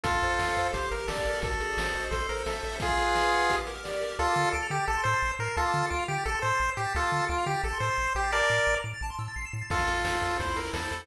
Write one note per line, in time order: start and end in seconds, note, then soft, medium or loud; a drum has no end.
0.04 0.19 F2 medium
0.04 0.68 F4 medium
0.04 0.68 A4 medium
0.04 0.70 A4 medium
0.04 kick medium
0.04 closed hi-hat loud
0.14 kick medium
0.14 closed hi-hat medium
0.22 0.37 F2 medium
0.22 0.56 C5 medium
0.22 closed hi-hat medium
0.30 closed hi-hat medium
0.39 0.54 F2 medium
0.39 0.71 F5 medium
0.39 snare medium
0.47 closed hi-hat medium
0.56 0.72 F2 medium
0.56 0.73 C5 medium
0.56 closed hi-hat medium
0.65 closed hi-hat medium
0.73 0.88 G1 medium
0.73 1.38 G4 loud
0.73 0.89 C5 medium
0.73 kick medium
0.73 closed hi-hat medium
0.83 closed hi-hat medium
0.91 1.06 G1 medium
0.91 1.26 A#4 medium
0.91 1.07 A#4 medium
0.91 closed hi-hat medium
0.99 closed hi-hat medium
1.08 1.23 G1 medium
1.08 1.40 A4 medium
1.08 1.41 D5 medium
1.08 snare medium
1.17 kick medium
1.17 closed hi-hat medium
1.26 1.40 G1 medium
1.26 1.43 A#4 medium
1.26 closed hi-hat medium
1.35 open hi-hat medium
1.42 1.57 G#1 medium
1.42 2.08 F#4 medium
1.42 2.05 A4 medium
1.42 kick medium
1.42 closed hi-hat medium
1.51 kick medium
1.51 closed hi-hat medium
1.60 1.75 G#1 medium
1.60 2.09 G#4 medium
1.60 closed hi-hat medium
1.69 closed hi-hat medium
1.77 1.92 G#1 medium
1.77 2.11 C5 medium
1.77 snare medium
1.86 closed hi-hat medium
1.95 2.09 G#1 medium
1.95 2.11 D#5 medium
1.95 closed hi-hat medium
2.03 closed hi-hat medium
2.11 2.26 A1 medium
2.11 2.77 A4 loud
2.11 2.27 C5 medium
2.11 kick medium
2.11 closed hi-hat medium
2.20 closed hi-hat medium
2.29 2.44 A1 medium
2.29 2.43 A#4 medium
2.29 2.64 C5 medium
2.29 closed hi-hat medium
2.37 closed hi-hat medium
2.46 2.61 A1 medium
2.46 2.76 A4 medium
2.46 2.79 E5 medium
2.46 snare medium
2.55 closed hi-hat soft
2.63 2.78 A1 medium
2.63 2.80 C5 medium
2.63 closed hi-hat medium
2.72 open hi-hat medium
2.80 3.56 F4 medium
2.80 3.47 G#4 medium
2.80 3.56 G#4 loud
2.80 kick medium
2.80 closed hi-hat medium
2.89 kick medium
2.89 closed hi-hat soft
2.98 3.47 B4 medium
2.98 closed hi-hat medium
3.06 closed hi-hat soft
3.15 3.48 D#5 medium
3.15 snare medium
3.25 closed hi-hat medium
3.32 3.49 F#5 medium
3.32 closed hi-hat medium
3.41 closed hi-hat medium
3.50 4.16 G4 loud
3.50 kick medium
3.50 closed hi-hat medium
3.58 closed hi-hat medium
3.67 4.01 A#4 medium
3.67 closed hi-hat medium
3.76 closed hi-hat medium
3.84 4.16 D5 medium
3.84 snare medium
3.93 closed hi-hat medium
4.01 4.17 A#4 medium
4.01 closed hi-hat medium
4.10 closed hi-hat medium
4.19 4.28 D2 medium
4.19 4.49 F4 loud
4.19 4.49 A4 loud
4.19 4.27 A5 loud
4.28 4.36 D6 medium
4.35 4.45 D3 medium
4.35 4.43 F6 medium
4.44 4.52 A6 medium
4.52 4.63 D2 medium
4.52 4.67 A4 medium
4.52 4.61 D7 medium
4.63 4.70 F7 medium
4.70 4.80 D3 medium
4.70 4.85 G4 medium
4.70 4.78 D7 medium
4.80 4.87 A6 medium
4.88 4.97 A1 medium
4.88 5.02 A4 medium
4.88 4.96 A5 loud
4.97 5.04 C6 medium
5.04 5.15 A2 medium
5.04 5.31 C5 medium
5.04 5.13 E6 medium
5.14 5.21 A6 medium
5.21 5.32 A1 medium
5.21 5.29 C7 medium
5.30 5.38 E7 medium
5.39 5.49 A2 medium
5.39 5.56 A#4 medium
5.39 5.47 C7 medium
5.47 5.55 A6 medium
5.56 5.66 D2 medium
5.56 5.86 F4 medium
5.56 5.86 A4 loud
5.56 5.64 A5 loud
5.65 5.72 D6 medium
5.73 5.83 D3 medium
5.73 5.81 F6 medium
5.82 5.90 A6 medium
5.90 6.01 D2 medium
5.90 6.04 F4 medium
5.90 5.98 D7 medium
5.99 6.07 F7 medium
6.08 6.18 D3 medium
6.08 6.24 G4 medium
6.08 6.16 D7 medium
6.18 6.26 A6 medium
6.26 6.35 A1 medium
6.26 6.39 A4 loud
6.26 6.34 A5 medium
6.34 6.42 C6 medium
6.42 6.52 A2 medium
6.42 6.70 C5 medium
6.42 6.50 E6 medium
6.51 6.59 A6 medium
6.60 6.69 A1 medium
6.60 6.68 C7 medium
6.69 6.77 E7 medium
6.77 6.87 A2 medium
6.77 6.93 G4 medium
6.77 6.84 C7 medium
6.85 6.93 A6 medium
6.95 7.04 D2 medium
6.95 7.25 F4 medium
6.95 7.25 A4 loud
6.95 7.03 A5 medium
7.03 7.11 D6 medium
7.12 7.21 D3 medium
7.12 7.20 F6 medium
7.21 7.28 A6 medium
7.28 7.39 D2 medium
7.28 7.45 F4 loud
7.28 7.36 D7 medium
7.38 7.46 F7 medium
7.46 7.56 D3 medium
7.46 7.62 G4 loud
7.46 7.54 D7 medium
7.54 7.62 A6 medium
7.63 7.73 A1 medium
7.63 7.78 A4 medium
7.63 7.71 A5 medium
7.73 7.80 C6 medium
7.80 7.90 A2 medium
7.80 8.13 C5 medium
7.80 7.89 E6 medium
7.89 7.97 A6 medium
7.97 8.07 A1 medium
7.97 8.05 C7 medium
8.06 8.14 E7 medium
8.15 8.42 A1 medium
8.15 8.31 G4 medium
8.15 8.23 C7 medium
8.24 8.32 A6 medium
8.32 8.75 A#4 loud
8.32 8.75 D5 loud
8.32 8.40 A5 medium
8.42 8.50 D6 medium
8.50 8.59 A2 medium
8.50 8.58 F6 medium
8.58 8.66 A6 medium
8.67 8.76 A1 medium
8.67 8.75 D7 medium
8.76 8.83 F7 medium
8.83 8.94 A2 medium
8.83 8.91 D7 medium
8.94 9.02 A6 medium
9.01 9.11 A1 medium
9.01 9.10 A5 loud
9.10 9.18 C6 medium
9.19 9.28 A2 medium
9.19 9.27 E6 medium
9.28 9.36 A6 medium
9.36 9.45 A1 medium
9.36 9.44 C7 medium
9.45 9.53 E7 medium
9.52 9.63 A2 medium
9.52 9.60 C7 medium
9.61 9.69 A6 medium
9.70 9.85 F2 medium
9.70 10.38 F4 medium
9.70 10.37 F4 medium
9.70 10.38 A4 medium
9.70 kick medium
9.70 crash medium
9.78 kick medium
9.78 closed hi-hat medium
9.87 10.02 F2 medium
9.87 10.21 A4 medium
9.87 closed hi-hat medium
9.97 closed hi-hat medium
10.05 10.19 F2 medium
10.05 10.38 C5 medium
10.05 snare medium
10.13 closed hi-hat medium
10.22 10.36 F2 medium
10.22 10.38 A4 medium
10.22 closed hi-hat medium
10.31 closed hi-hat medium
10.40 10.54 E2 medium
10.40 11.05 E4 loud
10.40 10.56 C5 medium
10.40 kick medium
10.40 closed hi-hat medium
10.48 closed hi-hat medium
10.56 10.71 E2 soft
10.56 10.91 A4 medium
10.56 10.71 A#4 medium
10.56 closed hi-hat medium
10.65 closed hi-hat medium
10.73 10.88 E2 medium
10.73 11.02 A4 medium
10.73 11.06 C5 medium
10.73 snare medium
10.83 closed hi-hat medium
10.91 11.06 E2 medium
10.91 11.07 A4 medium
10.91 closed hi-hat medium
10.99 closed hi-hat medium